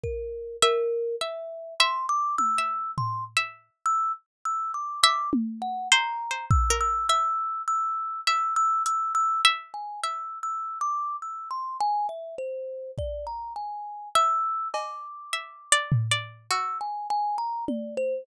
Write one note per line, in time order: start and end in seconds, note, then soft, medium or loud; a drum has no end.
0.03 0.56 A#4 medium
0.03 kick medium
0.62 1.16 A#4 loud
0.62 1.15 E5 loud
1.21 1.74 E5 medium
1.80 2.51 E5 loud
1.80 2.06 C6 medium
2.09 2.36 D6 loud
2.38 2.91 E6 loud
2.38 high tom medium
2.58 3.29 E5 medium
2.98 3.24 C6 medium
2.98 floor tom medium
3.37 4.07 E5 medium
3.86 4.12 E6 loud
4.45 4.72 E6 medium
4.74 5.00 D6 medium
5.03 5.30 E5 loud
5.03 5.30 D6 loud
5.33 high tom loud
5.62 5.88 F#5 medium
5.92 6.27 C5 loud
5.92 6.45 A#5 medium
6.31 6.66 C5 soft
6.50 6.77 E6 medium
6.50 kick loud
6.70 7.05 A#4 medium
6.80 7.07 E6 loud
7.09 7.89 E5 medium
7.09 7.62 E6 loud
7.68 8.21 E6 loud
8.27 9.33 E5 medium
8.27 8.54 E6 loud
8.56 8.83 E6 loud
8.86 9.13 E6 loud
8.86 closed hi-hat loud
9.15 9.41 E6 loud
9.45 9.98 E5 loud
9.74 10.00 G#5 medium
10.03 12.15 E5 medium
10.03 10.39 E6 medium
10.43 10.78 E6 medium
10.81 11.16 D6 medium
11.22 11.49 E6 soft
11.50 11.77 C6 medium
11.80 12.07 G#5 loud
12.09 12.35 E5 medium
12.38 12.91 C5 medium
12.98 13.25 D5 medium
12.98 kick medium
13.27 13.53 A#5 medium
13.56 14.09 G#5 medium
14.15 15.21 E5 medium
14.15 14.68 E6 loud
14.74 15.80 D6 medium
14.74 cowbell loud
15.33 15.68 E5 medium
15.72 16.07 D5 loud
15.92 floor tom loud
16.11 16.47 D5 medium
16.50 18.09 F#4 medium
16.50 16.78 E6 medium
16.81 17.07 G#5 medium
17.10 17.37 G#5 loud
17.38 17.64 A#5 medium
17.68 17.95 D5 soft
17.68 high tom medium
17.97 18.24 C5 loud